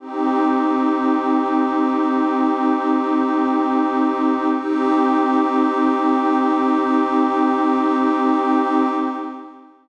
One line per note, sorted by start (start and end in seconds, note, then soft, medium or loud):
0.00 4.48 C4 medium
0.00 4.48 D#4 medium
0.00 4.48 G4 medium
4.53 8.88 C4 loud
4.53 8.88 D#4 loud
4.53 8.88 G4 loud